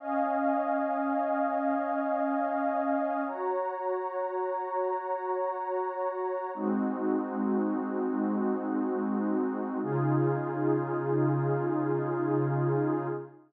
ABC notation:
X:1
M:3/4
L:1/8
Q:1/4=55
K:Db
V:1 name="Pad 2 (warm)"
[Defa]6 | [Gdb]6 | [A,CEG]6 | [D,EFA]6 |]